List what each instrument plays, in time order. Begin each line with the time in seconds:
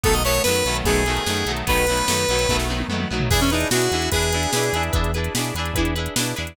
0.03 synth bass 1 B1, overdriven guitar D#3 F#3 A3 B3, lead 1 (square) A4, kick, closed hi-hat
0.13 lead 1 (square) D#5, closed hi-hat
0.24 overdriven guitar D#3 F#3 A3 B3, lead 1 (square) C#5, closed hi-hat
0.35 closed hi-hat
0.43 synth bass 1 F#2, overdriven guitar F#3 A3 B3, lead 1 (square) B4, snare
0.48 overdriven guitar D#3
0.56 closed hi-hat
0.65 synth bass 1 B1, overdriven guitar F#3 A3 B3, closed hi-hat
0.69 overdriven guitar D#3
0.75 closed hi-hat
0.84 synth bass 1 B1, overdriven guitar D#3 F#3 A3 B3, lead 1 (square) G#4, kick, closed hi-hat
0.96 closed hi-hat
1.06 overdriven guitar D#3 F#3 A3 B3, closed hi-hat
1.16 closed hi-hat
1.26 synth bass 1 F#2, overdriven guitar D#3 F#3 A3 B3, snare
1.37 closed hi-hat
1.46 synth bass 1 B1, overdriven guitar D#3 F#3 A3 B3, closed hi-hat
1.57 closed hi-hat
1.67 synth bass 1 B1, overdriven guitar D#3 F#3 A3 B3, lead 1 (square) B4, kick, closed hi-hat
1.77 closed hi-hat
1.87 overdriven guitar F#3 A3 B3, closed hi-hat
1.91 overdriven guitar D#3
1.97 closed hi-hat
2.08 synth bass 1 F#2, overdriven guitar D#3 F#3 A3 B3, snare
2.18 closed hi-hat
2.29 synth bass 1 B1, overdriven guitar D#3 F#3 A3 B3, closed hi-hat
2.39 closed hi-hat
2.49 synth bass 1 B1, overdriven guitar D#3 F#3 A3 B3, kick, snare
2.60 snare
2.68 overdriven guitar D#3 F#3 A3 B3, high tom
2.80 high tom
2.88 synth bass 1 F#2, overdriven guitar F#3 A3 B3, mid tom
2.93 overdriven guitar D#3
3.00 mid tom
3.10 synth bass 1 B1, overdriven guitar D#3 F#3 A3 B3
3.20 floor tom
3.30 synth bass 1 E2, overdriven guitar D4 E4 G#4 B4, lead 1 (square) G#4, kick, crash
3.41 lead 1 (square) C#4, closed hi-hat
3.50 lead 1 (square) D#4, overdriven guitar E4 G#4 B4, closed hi-hat
3.54 overdriven guitar D4
3.60 closed hi-hat
3.71 synth bass 1 B2, overdriven guitar E4 G#4 B4, lead 1 (square) F#4, snare
3.75 overdriven guitar D4
3.81 closed hi-hat
3.91 synth bass 1 E2, overdriven guitar D4 E4 G#4 B4, closed hi-hat
4.02 closed hi-hat
4.11 synth bass 1 E2, overdriven guitar D4 E4 G#4 B4, lead 1 (square) G#4, kick, closed hi-hat
4.22 closed hi-hat
4.32 overdriven guitar D4 E4 G#4 B4, closed hi-hat
4.43 closed hi-hat
4.53 synth bass 1 B2, overdriven guitar D4 E4 G#4 B4, snare
4.63 closed hi-hat
4.73 synth bass 1 E2, overdriven guitar D4 E4 G#4 B4, closed hi-hat
4.83 closed hi-hat
4.93 synth bass 1 E2, overdriven guitar D4 E4 G#4 B4, kick, closed hi-hat
5.04 closed hi-hat
5.14 overdriven guitar D4 E4 G#4 B4, closed hi-hat
5.24 closed hi-hat
5.35 synth bass 1 B2, overdriven guitar D4 E4 G#4 B4, snare
5.44 closed hi-hat
5.55 synth bass 1 E2, overdriven guitar E4 G#4 B4, closed hi-hat
5.59 overdriven guitar D4
5.65 closed hi-hat
5.74 synth bass 1 E2, overdriven guitar E4 G#4 B4, kick, closed hi-hat
5.79 overdriven guitar D4
5.85 closed hi-hat
5.95 overdriven guitar D4 E4 G#4 B4, closed hi-hat
6.06 closed hi-hat
6.16 synth bass 1 B2, overdriven guitar D4 E4 G#4 B4, snare
6.26 closed hi-hat
6.36 synth bass 1 E2, overdriven guitar D4 E4 G#4 B4, closed hi-hat
6.47 closed hi-hat